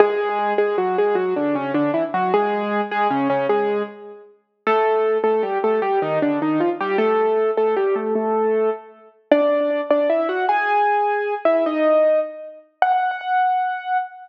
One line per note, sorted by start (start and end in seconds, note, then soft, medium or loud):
0.00 0.53 G#3 loud
0.00 0.53 G#4 loud
0.58 0.76 G#3 medium
0.58 0.76 G#4 loud
0.78 0.97 F#3 medium
0.78 0.97 F#4 medium
0.98 1.15 G#3 medium
0.98 1.15 G#4 loud
1.15 1.34 F#3 medium
1.15 1.34 F#4 loud
1.36 1.55 D3 medium
1.36 1.55 D4 loud
1.55 1.72 C#3 medium
1.55 1.72 C#4 loud
1.74 1.91 D3 medium
1.74 1.91 D4 loud
1.94 2.03 E3 medium
1.94 2.03 E4 loud
2.14 2.32 F#3 medium
2.14 2.32 F#4 medium
2.34 2.81 G#3 loud
2.34 2.81 G#4 loud
2.91 3.08 G#3 medium
2.91 3.08 G#4 loud
3.11 3.28 C#3 medium
3.11 3.28 C#4 loud
3.30 3.47 C#3 loud
3.30 3.47 C#4 loud
3.49 3.83 G#3 medium
3.49 3.83 G#4 loud
4.67 5.18 A3 medium
4.67 5.18 A4 loud
5.24 5.42 A3 medium
5.24 5.42 A4 medium
5.43 5.58 G3 medium
5.43 5.58 G4 medium
5.64 5.80 A3 medium
5.64 5.80 A4 medium
5.82 5.99 G3 medium
5.82 5.99 G4 loud
6.02 6.19 D#3 medium
6.02 6.19 D#4 loud
6.22 6.39 D3 medium
6.22 6.39 D4 medium
6.42 6.60 D#3 medium
6.42 6.60 D#4 medium
6.60 6.69 F3 medium
6.60 6.69 F4 medium
6.81 6.97 G3 medium
6.81 6.97 G4 medium
6.98 7.51 A3 medium
6.98 7.51 A4 loud
7.57 7.75 A3 medium
7.57 7.75 A4 medium
7.77 7.95 G3 medium
7.77 7.95 G4 loud
7.96 8.14 A3 medium
7.96 8.14 A4 medium
8.15 8.70 A3 loud
8.15 8.70 A4 loud
9.31 9.81 D4 medium
9.31 9.81 D5 medium
9.91 10.08 D4 medium
9.91 10.08 D5 medium
10.10 10.28 E4 medium
10.10 10.28 E5 medium
10.29 10.46 F#4 medium
10.29 10.46 F#5 medium
10.49 11.34 G#4 medium
10.49 11.34 G#5 loud
11.45 11.64 E4 medium
11.45 11.64 E5 medium
11.66 12.20 D#4 medium
11.66 12.20 D#5 medium
12.82 13.97 F#5 loud